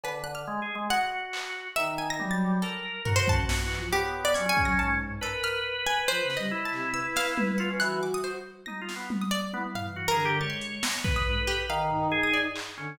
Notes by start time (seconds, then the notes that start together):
0.04 D3 B4, cowbell
0.24 F#6
0.35 F6
0.47 G#3
0.62 G#4
0.75 G#3
0.90 F#4 F#5
1.33 clap
1.75 D#3 D#4 E5
1.98 G#5
2.10 A#6
2.19 F#3 G3, high tom
2.31 A6
2.62 A4 A#4
3.05 C#4 F#4 A#4, floor tom
3.16 C5
3.28 A5, kick
3.49 A#2, snare
3.63 E3
3.71 clap
3.77 F3
3.92 B3 G4 C#5
4.25 D5
4.34 F#3 C#4 G#6, closed hi-hat
4.46 C#4 G#4 G#5
4.57 kick
4.63 F#3 A#6
4.78 G#2 A5
5.00 floor tom
5.21 A4 A#4 B4, cowbell
5.43 F6, closed hi-hat
5.87 G#5
6.08 F3 C5
6.23 C#3
6.30 snare
6.37 G3 D#5
6.51 E4
6.65 A5
6.72 C3, clap
6.93 B4 E6
7.16 F5, snare
7.38 high tom
7.58 F4 F#5
7.70 C#4
7.80 E3 F#4 F#6, closed hi-hat
8.03 D6
8.14 D#6
8.24 C5
8.66 D#4 A#6, high tom
8.81 F4
8.89 snare
8.96 B3
9.10 high tom
9.21 D#6
9.31 D5
9.53 B3 E4, high tom
9.75 F5, floor tom
9.83 E3
9.96 F#4
10.08 D3 G#4 A#4
10.25 G4
10.40 G#3 C#5 A6
10.50 C6
10.61 closed hi-hat
10.83 A#6, snare
11.04 B4, kick
11.16 D#6
11.27 G#2
11.36 A4
11.47 G4
11.69 D#3 F5
11.91 D#4, floor tom
12.12 G#4
12.23 D#6
12.33 D5
12.56 clap
12.77 D3 C#4